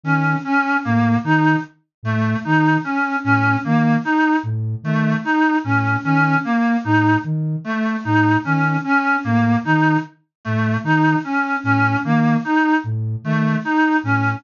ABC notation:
X:1
M:2/4
L:1/8
Q:1/4=75
K:none
V:1 name="Flute" clef=bass
^D, z A,, D, | z A,, ^D, z | A,, ^D, z A,, | ^D, z A,, D, |
z A,, ^D, z | A,, ^D, z A,, | ^D, z A,, D, | z A,, ^D, z |
A,, ^D, z A,, |]
V:2 name="Clarinet"
^C C ^A, ^D | z A, ^D ^C | ^C ^A, ^D z | A, ^D ^C C |
^A, ^D z =A, | ^D ^C C ^A, | ^D z A, D | ^C C ^A, ^D |
z A, ^D ^C |]